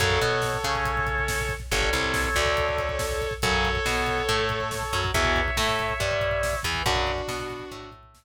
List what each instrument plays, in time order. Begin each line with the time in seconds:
0.00 electric bass (finger) F#2, overdriven guitar C#3 F#3, distortion guitar A4 C#5, kick, closed hi-hat
0.10 kick
0.21 electric bass (finger) B2, overdriven guitar B3, kick, closed hi-hat
0.32 kick
0.42 kick, snare
0.54 kick
0.64 electric bass (finger) C#3, overdriven guitar C#4, kick, closed hi-hat
0.75 kick
0.85 kick, closed hi-hat
0.97 kick
1.07 kick, closed hi-hat
1.18 kick
1.28 kick, snare
1.40 kick
1.49 kick, closed hi-hat
1.60 kick
1.71 electric bass (finger) G1, overdriven guitar D3 G3, distortion guitar A4 C#5, kick, closed hi-hat
1.82 kick
1.93 electric bass (finger) C2, overdriven guitar C3, kick, closed hi-hat
2.04 kick
2.14 kick, snare
2.24 kick
2.35 electric bass (finger) D2, overdriven guitar D3, kick, closed hi-hat
2.46 kick
2.57 kick, closed hi-hat
2.68 kick
2.78 kick, closed hi-hat
2.89 kick
2.99 kick, snare
3.11 kick
3.21 kick, closed hi-hat
3.31 kick
3.42 electric bass (finger) F#2, overdriven guitar C#3 F#3, distortion guitar A4 C#5, kick, closed hi-hat
3.53 kick
3.65 kick, closed hi-hat
3.75 kick
3.86 electric bass (finger) B2, overdriven guitar B3, kick, snare
3.97 kick
4.06 kick, closed hi-hat
4.18 kick
4.28 electric bass (finger) A2, overdriven guitar A3, kick, closed hi-hat
4.39 kick
4.49 kick, closed hi-hat
4.60 kick
4.71 kick, snare
4.83 kick
4.93 electric bass (finger) F#2, overdriven guitar F#3, kick, closed hi-hat
5.04 kick
5.14 electric bass (finger) E2, overdriven guitar B2 E3, distortion guitar C#5 E5, kick, closed hi-hat
5.25 kick
5.36 kick, closed hi-hat
5.48 kick
5.57 electric bass (finger) A2, overdriven guitar A3, kick, snare
5.69 kick
5.79 kick, closed hi-hat
5.90 kick
6.00 electric bass (finger) G2, overdriven guitar G3, kick, closed hi-hat
6.11 kick
6.21 kick, closed hi-hat
6.31 kick
6.43 kick, snare
6.53 kick
6.63 electric bass (finger) E2, overdriven guitar E3, kick, open hi-hat
6.75 kick
6.86 electric bass (finger) F#2, overdriven guitar C#3 F#3, distortion guitar D4 F#4, kick, closed hi-hat
6.96 kick
7.07 kick, closed hi-hat
7.18 kick
7.28 electric bass (finger) B2, overdriven guitar B3, kick, snare
7.40 kick
7.50 kick, closed hi-hat
7.59 kick
7.71 electric bass (finger) A2, overdriven guitar A3, kick, closed hi-hat
7.83 kick
7.92 kick, closed hi-hat
8.03 kick
8.14 kick, snare